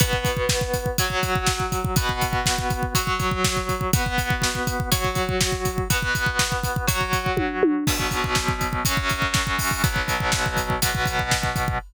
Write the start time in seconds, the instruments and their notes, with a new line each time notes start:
0.00 overdriven guitar B3 F#4 B4, kick, closed hi-hat
0.13 kick
0.25 kick, closed hi-hat
0.37 kick
0.49 kick, snare
0.61 kick
0.74 kick, closed hi-hat
0.86 kick
0.98 overdriven guitar F#3 F#4 C#5, kick, closed hi-hat
1.10 kick
1.23 kick, closed hi-hat
1.36 kick
1.47 kick, snare
1.60 kick
1.72 kick, closed hi-hat
1.85 kick
1.96 overdriven guitar B3 F#4 B4, kick, closed hi-hat
2.09 kick
2.21 kick, closed hi-hat
2.33 kick
2.46 kick, snare
2.58 kick
2.70 kick, closed hi-hat
2.83 kick
2.95 overdriven guitar F#3 F#4 C#5, kick, closed hi-hat
3.07 kick
3.20 kick, closed hi-hat
3.31 kick
3.44 kick, snare
3.57 kick
3.69 kick, closed hi-hat
3.81 kick
3.93 overdriven guitar B3 F#4 B4, kick, closed hi-hat
4.06 kick
4.18 kick, closed hi-hat
4.30 kick
4.42 kick, snare
4.55 kick
4.67 kick, closed hi-hat
4.80 kick
4.92 overdriven guitar F#3 F#4 C#5, kick, closed hi-hat
5.05 kick
5.15 kick, closed hi-hat
5.29 kick
5.41 kick, snare
5.52 kick
5.65 kick, closed hi-hat
5.78 kick
5.90 overdriven guitar B3 F#4 B4, kick, closed hi-hat
6.02 kick
6.15 kick, closed hi-hat
6.26 kick
6.39 kick, snare
6.52 kick
6.64 kick, closed hi-hat
6.76 kick
6.87 overdriven guitar F#3 F#4 C#5, kick, closed hi-hat
7.01 kick
7.13 kick, closed hi-hat
7.26 kick
7.37 kick, high tom
7.63 high tom
7.87 overdriven guitar B2 F#3 B3, kick, crash
8.00 kick
8.11 kick, closed hi-hat
8.24 kick
8.35 kick, snare
8.48 kick
8.61 kick, closed hi-hat
8.73 kick
8.85 overdriven guitar F#2 F#3 C#4, kick, closed hi-hat
8.97 kick
9.10 kick, closed hi-hat
9.22 kick
9.34 kick, snare
9.47 kick
9.59 kick, open hi-hat
9.71 kick
9.84 overdriven guitar B2 F#3 B3, kick, closed hi-hat
9.96 kick
10.08 kick, closed hi-hat
10.20 kick
10.32 kick, snare
10.46 kick
10.57 kick, closed hi-hat
10.70 kick
10.82 overdriven guitar B2 F#3 B3, kick, closed hi-hat
10.95 kick
11.06 kick, closed hi-hat
11.19 kick
11.31 kick, snare
11.43 kick
11.56 kick, closed hi-hat
11.68 kick